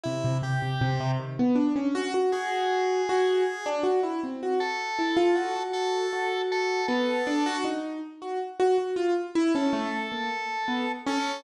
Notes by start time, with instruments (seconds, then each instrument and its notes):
0.03 acoustic grand piano C3, drawbar organ E4
0.24 acoustic grand piano C3
0.42 acoustic grand piano C3, drawbar organ G4
0.62 acoustic grand piano C3
0.81 acoustic grand piano C3
1.00 acoustic grand piano C3
1.19 acoustic grand piano D#3
1.39 acoustic grand piano B3
1.55 acoustic grand piano D4
1.76 acoustic grand piano C#4
1.95 acoustic grand piano F#4
2.14 acoustic grand piano F#4
2.32 acoustic grand piano F#4, drawbar organ G#4
3.09 acoustic grand piano F#4
3.66 acoustic grand piano D4
3.83 acoustic grand piano F#4
4.03 acoustic grand piano E4
4.24 acoustic grand piano C4
4.43 acoustic grand piano F#4
4.60 acoustic grand piano F#4, drawbar organ A4
4.99 acoustic grand piano E4
5.17 acoustic grand piano F4
5.35 acoustic grand piano F#4
5.56 acoustic grand piano F#4
5.73 drawbar organ A4
6.13 acoustic grand piano F#4
6.52 drawbar organ A4
6.88 acoustic grand piano B3, drawbar organ A4
7.27 acoustic grand piano D4
7.46 acoustic grand piano F#4
7.64 acoustic grand piano D#4
8.22 acoustic grand piano F#4
8.60 acoustic grand piano F#4
8.78 acoustic grand piano F#4
8.96 acoustic grand piano F4
9.35 acoustic grand piano E4
9.55 acoustic grand piano C#4, drawbar organ A4
9.73 acoustic grand piano A3
10.12 acoustic grand piano A#3
10.68 acoustic grand piano B3
11.06 acoustic grand piano C#4, drawbar organ A4